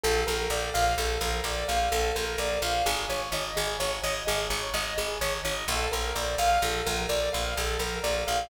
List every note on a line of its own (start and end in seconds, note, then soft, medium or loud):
0.04 0.24 A#1 loud
0.04 0.25 A4 loud
0.27 0.48 A#1 medium
0.27 0.48 A#4 medium
0.50 0.70 A#1 medium
0.50 0.72 D5 medium
0.74 0.95 A#1 medium
0.74 0.95 F5 loud
0.98 1.18 A#1 loud
0.98 1.19 A4 medium
1.21 1.41 A#1 medium
1.21 1.43 A#4 medium
1.44 1.64 A#1 medium
1.44 1.66 D5 medium
1.68 1.89 A#1 medium
1.68 1.89 F5 medium
1.92 2.12 A#1 medium
1.92 2.13 A4 medium
2.15 2.36 A#1 medium
2.15 2.37 A#4 medium
2.38 2.58 A#1 medium
2.38 2.60 D5 medium
2.62 2.82 A#1 medium
2.62 2.84 F5 medium
2.86 3.06 G#1 loud
2.86 3.07 G#4 loud
3.10 3.30 G#1 medium
3.10 3.31 C#5 medium
3.32 3.52 G#1 medium
3.32 3.54 D#5 medium
3.56 3.77 G#1 loud
3.56 3.78 G#4 medium
3.80 4.00 G#1 medium
3.80 4.01 C#5 medium
4.04 4.24 G#1 medium
4.04 4.25 D#5 medium
4.27 4.48 G#1 loud
4.27 4.48 G#4 medium
4.50 4.70 G#1 medium
4.50 4.72 C#5 medium
4.74 4.94 G#1 medium
4.74 4.95 D#5 medium
4.98 5.18 G#1 medium
4.98 5.19 G#4 medium
5.21 5.41 G#1 medium
5.21 5.42 C#5 medium
5.45 5.65 G#1 medium
5.45 5.66 D#5 medium
5.68 5.88 A#1 loud
5.68 5.90 A4 loud
5.92 6.13 A#1 medium
5.92 6.13 A#4 medium
6.15 6.36 A#1 medium
6.15 6.36 D5 medium
6.38 6.58 A#1 medium
6.38 6.60 F5 loud
6.62 6.82 A#1 loud
6.62 6.84 A4 medium
6.86 7.06 A#1 medium
6.86 7.07 A#4 medium
7.09 7.29 A#1 medium
7.09 7.30 D5 medium
7.33 7.54 A#1 medium
7.33 7.54 F5 medium
7.57 7.77 A#1 medium
7.57 7.78 A4 medium
7.79 7.99 A#1 medium
7.79 8.01 A#4 medium
8.04 8.24 A#1 medium
8.04 8.25 D5 medium
8.27 8.48 A#1 medium
8.27 8.48 F5 medium